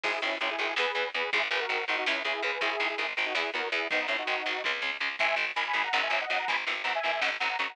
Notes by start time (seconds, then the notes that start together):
0.04 G#1 D#3 G#3 E4 G#4, kick, crash
0.22 G#1 D#3 G#3 C#4 E4, closed hi-hat
0.41 G#1 D#3 G#3 C#4 E4, closed hi-hat
0.51 E4 G#4
0.59 G#1 D#3 G#3 E4 G#4, closed hi-hat
0.76 E2 E3 B3 G#4 B4, snare
0.95 E2 E3 B3, closed hi-hat
1.14 E2 E3 B3 G#4 B4, closed hi-hat
1.33 G#1 D#3 G#3 E4 G#4, kick, closed hi-hat
1.51 G#1 D#3 G#3 G#4 B4, closed hi-hat
1.61 F#4 A#4
1.69 G#1 D#3 G#3, closed hi-hat
1.88 G#1 D#3 G#3 D#4 F#4, closed hi-hat
1.98 D#4 F#4
2.06 C#2 C#3 G#3 C#4 E4, snare
2.25 C#2 C#3 G#3 E4 G#4, closed hi-hat
2.43 C#2 C#3 G#3 G#4 B4, closed hi-hat
2.61 G#1 D#3 G#3 E4 G#4, kick, closed hi-hat
2.80 G#1 D#3 G#3, closed hi-hat
2.89 E4 G#4
2.98 G#1 D#3 G#3 E4 G#4, closed hi-hat
3.17 G#1 D#3 G#3, closed hi-hat
3.25 D#4 F#4
3.35 E2 E3 B3 E4 G#4, snare
3.54 E2 E3 B3 F#4 A#4, closed hi-hat
3.72 E2 E3 B3 E4 G#4, closed hi-hat
3.90 G#1 D#3 G#3 B3 D#4, kick, closed hi-hat
4.08 G#1 D#3 G#3 C#4 E4, closed hi-hat
4.18 D#4 F#4
4.27 G#1 D#3 G#3, closed hi-hat
4.46 G#1 D#3 G#3, closed hi-hat
4.64 C#2 C#3 G#3, kick, high tom
4.82 C#2 C#3 G#3, floor tom
5.00 C#2 C#3 G#3
5.19 G#1 D#3 G#3 E5 G#5, kick, closed hi-hat
5.36 G#1 D#3 G#3, closed hi-hat
5.56 G#1 D#3 G#3 G#5 B5, closed hi-hat
5.66 G#5 B5
5.73 G#1 D#3 G#3, closed hi-hat
5.84 F#5 A#5
5.93 G#1 C#3 F#3 F#5 A#5, snare
6.03 E5 G#5
6.10 G#1 C#3 F#3 E5 G#5, closed hi-hat
6.21 D#5 F#5
6.30 G#1 C#3 F#3 D#5 F#5, closed hi-hat
6.39 F#5 A#5
6.48 G#1 B2 E3 G#5 B5, kick, closed hi-hat
6.67 G#1 B2 E3, closed hi-hat
6.84 G#1 B2 E3 F#5 A#5, closed hi-hat
6.95 E5 G#5
7.03 G#1 B2 E3, closed hi-hat
7.12 E5 G#5
7.21 G#1 C#3 F#3 D#5 F#5, snare
7.40 G#1 C#3 F#3 F#5 A#5, closed hi-hat
7.49 F#5 A#5
7.59 G#1 C#3 F#3 A#5 C#6, closed hi-hat
7.69 F#5 A#5